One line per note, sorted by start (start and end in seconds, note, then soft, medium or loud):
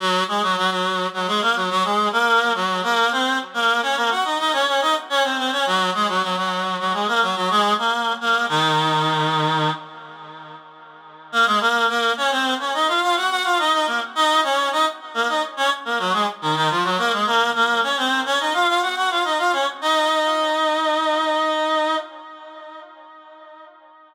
0.00 0.24 F#3 medium
0.00 0.24 F#4 loud
0.28 0.42 G#3 medium
0.28 0.42 G#4 medium
0.43 0.56 F#3 medium
0.43 0.56 F#4 medium
0.57 0.70 F#3 medium
0.57 0.70 F#4 medium
0.71 1.07 F#3 medium
0.71 1.07 F#4 medium
1.13 1.27 F#3 medium
1.13 1.27 F#4 medium
1.27 1.41 G#3 medium
1.27 1.41 G#4 medium
1.42 1.55 A#3 medium
1.42 1.55 A#4 medium
1.56 1.69 F#3 medium
1.56 1.69 F#4 medium
1.70 1.83 F#3 medium
1.70 1.83 F#4 medium
1.84 2.09 G#3 medium
1.84 2.09 G#4 medium
2.12 2.53 A#3 medium
2.12 2.53 A#4 medium
2.55 2.81 F#3 medium
2.55 2.81 F#4 medium
2.83 3.10 A#3 medium
2.83 3.10 A#4 medium
3.12 3.38 C4 medium
3.12 3.38 C5 medium
3.54 3.81 A#3 medium
3.54 3.81 A#4 medium
3.82 3.96 C#4 medium
3.82 3.96 C#5 medium
3.96 4.10 A#3 medium
3.96 4.10 A#4 medium
4.10 4.24 F#4 medium
4.10 4.24 F#5 medium
4.24 4.38 D#4 medium
4.24 4.38 D#5 medium
4.39 4.52 D#4 medium
4.39 4.52 D#5 medium
4.53 4.66 C#4 medium
4.53 4.66 C#5 medium
4.67 4.80 C#4 medium
4.67 4.80 C#5 medium
4.81 4.95 D#4 medium
4.81 4.95 D#5 medium
5.10 5.23 C#4 medium
5.10 5.23 C#5 loud
5.24 5.37 C4 medium
5.24 5.37 C5 medium
5.38 5.51 C4 medium
5.38 5.51 C5 medium
5.52 5.65 C#4 medium
5.52 5.65 C#5 medium
5.66 5.90 F#3 medium
5.66 5.90 F#4 medium
5.94 6.08 G#3 medium
5.94 6.08 G#4 medium
6.08 6.22 F#3 medium
6.08 6.22 F#4 medium
6.22 6.36 F#3 medium
6.22 6.36 F#4 medium
6.37 6.77 F#3 medium
6.37 6.77 F#4 medium
6.79 6.93 F#3 medium
6.79 6.93 F#4 medium
6.93 7.07 G#3 medium
6.93 7.07 G#4 medium
7.08 7.21 A#3 medium
7.08 7.21 A#4 medium
7.22 7.35 F#3 medium
7.22 7.35 F#4 medium
7.36 7.49 F#3 medium
7.36 7.49 F#4 medium
7.50 7.74 G#3 medium
7.50 7.74 G#4 loud
7.78 8.13 A#3 medium
7.78 8.13 A#4 medium
8.21 8.46 A#3 medium
8.21 8.46 A#4 medium
8.49 9.70 D#3 medium
8.49 9.70 D#4 loud
11.32 11.46 A#3 medium
11.32 11.46 A#4 medium
11.46 11.60 G#3 medium
11.46 11.60 G#4 medium
11.60 11.86 A#3 medium
11.60 11.86 A#4 medium
11.89 12.12 A#3 medium
11.89 12.12 A#4 medium
12.17 12.31 C#4 medium
12.17 12.31 C#5 medium
12.31 12.54 C4 medium
12.31 12.54 C5 medium
12.59 12.73 C#4 medium
12.59 12.73 C#5 medium
12.74 12.87 D#4 medium
12.74 12.87 D#5 medium
12.88 13.01 F4 medium
12.88 13.01 F5 medium
13.02 13.15 F4 medium
13.02 13.15 F5 medium
13.16 13.29 F#4 medium
13.16 13.29 F#5 medium
13.30 13.44 F#4 medium
13.30 13.44 F#5 medium
13.44 13.58 F4 medium
13.44 13.58 F5 medium
13.59 13.72 D#4 medium
13.59 13.72 D#5 medium
13.73 13.86 D#4 medium
13.73 13.86 D#5 medium
13.87 14.00 A#3 medium
13.87 14.00 A#4 medium
14.15 14.41 D#4 medium
14.15 14.41 D#5 loud
14.44 14.69 C#4 medium
14.44 14.69 C#5 medium
14.72 14.85 D#4 medium
14.72 14.85 D#5 medium
15.14 15.27 A#3 medium
15.14 15.27 A#4 medium
15.28 15.42 D#4 medium
15.28 15.42 D#5 medium
15.57 15.70 C#4 medium
15.57 15.70 C#5 medium
15.85 15.98 A#3 medium
15.85 15.98 A#4 medium
15.99 16.13 F#3 medium
15.99 16.13 F#4 medium
16.13 16.26 G#3 medium
16.13 16.26 G#4 medium
16.42 16.55 D#3 medium
16.42 16.55 D#4 medium
16.56 16.69 D#3 medium
16.56 16.69 D#4 medium
16.70 16.83 F3 medium
16.70 16.83 F4 medium
16.84 16.97 F#3 medium
16.84 16.97 F#4 medium
16.98 17.12 A#3 medium
16.98 17.12 A#4 medium
17.12 17.26 G#3 medium
17.12 17.26 G#4 medium
17.26 17.50 A#3 medium
17.26 17.50 A#4 medium
17.55 17.81 A#3 medium
17.55 17.81 A#4 medium
17.83 17.96 C#4 medium
17.83 17.96 C#5 medium
17.97 18.21 C4 medium
17.97 18.21 C5 medium
18.25 18.39 C#4 medium
18.25 18.39 C#5 medium
18.40 18.53 D#4 medium
18.40 18.53 D#5 medium
18.54 18.67 F4 medium
18.54 18.67 F5 medium
18.68 18.81 F4 medium
18.68 18.81 F5 medium
18.82 18.95 F#4 medium
18.82 18.95 F#5 medium
18.96 19.10 F#4 medium
18.96 19.10 F#5 medium
19.10 19.24 F4 medium
19.10 19.24 F5 medium
19.24 19.38 D#4 medium
19.24 19.38 D#5 medium
19.38 19.52 F4 medium
19.38 19.52 F5 medium
19.53 19.66 C#4 medium
19.53 19.66 C#5 medium
19.81 21.96 D#4 medium
19.81 21.96 D#5 medium